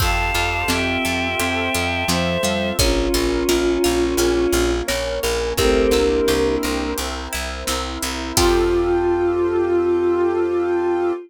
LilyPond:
<<
  \new Staff \with { instrumentName = "Choir Aahs" } { \time 4/4 \key f \lydian \tempo 4 = 86 <f'' a''>4 <e'' g''>2 <c'' e''>4 | <des' f'>2. r4 | <a c'>8 <bes d'>4. r2 | f'1 | }
  \new Staff \with { instrumentName = "Vibraphone" } { \time 4/4 \key f \lydian r4 c'4 c'4 f8 g8 | r4 f'4 f'4 des''8 bes'8 | <g' bes'>4. r2 r8 | f'1 | }
  \new Staff \with { instrumentName = "Pizzicato Strings" } { \time 4/4 \key f \lydian c'8 f'8 g'8 a'8 g'8 f'8 c'8 f'8 | des'8 f'8 bes'8 f'8 des'8 f'8 bes'8 f'8 | c'8 e'8 g'8 bes'8 g'8 e'8 c'8 e'8 | <c' f' g' a'>1 | }
  \new Staff \with { instrumentName = "Electric Bass (finger)" } { \clef bass \time 4/4 \key f \lydian f,8 f,8 f,8 f,8 f,8 f,8 f,8 f,8 | bes,,8 bes,,8 bes,,8 bes,,8 bes,,8 bes,,8 bes,,8 bes,,8 | c,8 c,8 c,8 c,8 c,8 c,8 c,8 c,8 | f,1 | }
  \new Staff \with { instrumentName = "Brass Section" } { \time 4/4 \key f \lydian <c' f' g' a'>2 <c' f' a' c''>2 | <des' f' bes'>2 <bes des' bes'>2 | <c' e' g' bes'>2 <c' e' bes' c''>2 | <c' f' g' a'>1 | }
  \new DrumStaff \with { instrumentName = "Drums" } \drummode { \time 4/4 <cymc bd>4 sn4 hh4 sn4 | <hh bd>4 sn4 hh4 sn4 | <hh bd>4 sn4 hh4 sn4 | <cymc bd>4 r4 r4 r4 | }
>>